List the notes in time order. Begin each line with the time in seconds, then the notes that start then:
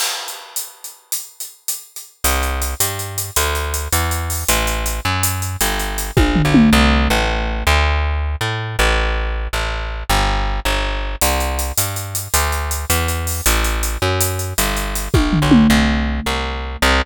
0.00 crash
0.28 closed hi-hat
0.56 closed hi-hat
0.84 closed hi-hat
1.12 closed hi-hat
1.40 closed hi-hat
1.68 closed hi-hat
1.96 closed hi-hat
2.24 C2, closed hi-hat
2.43 closed hi-hat
2.62 closed hi-hat
2.80 G2, closed hi-hat
2.99 closed hi-hat
3.18 closed hi-hat
3.36 D2, closed hi-hat
3.55 closed hi-hat
3.74 closed hi-hat
3.93 E2, closed hi-hat
4.11 closed hi-hat
4.30 open hi-hat
4.48 A1, closed hi-hat
4.67 closed hi-hat
4.86 closed hi-hat
5.05 F#2
5.23 closed hi-hat
5.42 closed hi-hat
5.61 G1, closed hi-hat
5.80 closed hi-hat
5.98 closed hi-hat
6.17 A#1, kick, high tom
6.36 floor tom
6.45 B1
6.54 mid tom
6.73 C2
7.10 A1
7.67 D2
8.41 A2
8.79 A1
9.53 A1
10.10 G1
10.65 G1
11.21 C2, closed hi-hat
11.40 closed hi-hat
11.59 closed hi-hat
11.77 G2, closed hi-hat
11.96 closed hi-hat
12.15 closed hi-hat
12.34 D2, closed hi-hat
12.52 closed hi-hat
12.71 closed hi-hat
12.90 E2, closed hi-hat
13.08 closed hi-hat
13.27 open hi-hat
13.46 A1, closed hi-hat
13.64 closed hi-hat
13.83 closed hi-hat
14.02 F#2
14.21 closed hi-hat
14.39 closed hi-hat
14.58 G1, closed hi-hat
14.77 closed hi-hat
14.95 closed hi-hat
15.14 A#1, kick, high tom
15.33 floor tom
15.42 B1
15.51 mid tom
15.70 C2
16.26 C2
16.82 C2